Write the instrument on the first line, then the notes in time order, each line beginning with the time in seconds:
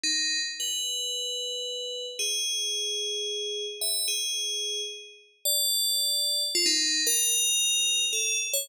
tubular bells
0.04 D#4
0.60 B4
2.19 G#4
3.81 E5
4.08 G#4
5.45 D5
6.55 F4
6.66 D#4
7.07 A#4
8.13 A4
8.53 C#5